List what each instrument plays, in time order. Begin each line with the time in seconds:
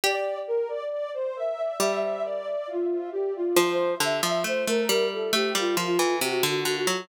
0.04 harpsichord G4, ocarina D5
0.47 ocarina A#4
0.68 ocarina D5
0.91 ocarina D5
1.14 ocarina C5
1.36 ocarina E5
1.80 harpsichord G3, ocarina E5
2.02 ocarina E5
2.24 ocarina D5
2.67 ocarina F4
3.12 ocarina G4
3.35 ocarina F4
3.56 harpsichord F3, ocarina C5
4.00 harpsichord D3, ocarina E5
4.23 harpsichord F3, ocarina E5
4.44 harpsichord A3, ocarina C5
4.66 harpsichord A3, ocarina A#4
4.89 harpsichord G3
5.13 ocarina A4
5.33 harpsichord A3, ocarina G4
5.55 harpsichord G3, ocarina F4
5.77 harpsichord F3, ocarina F4
5.99 harpsichord E3
6.21 harpsichord C3, ocarina F#4
6.43 harpsichord D3, ocarina F#4
6.65 harpsichord D3, ocarina F#4
6.87 harpsichord F#3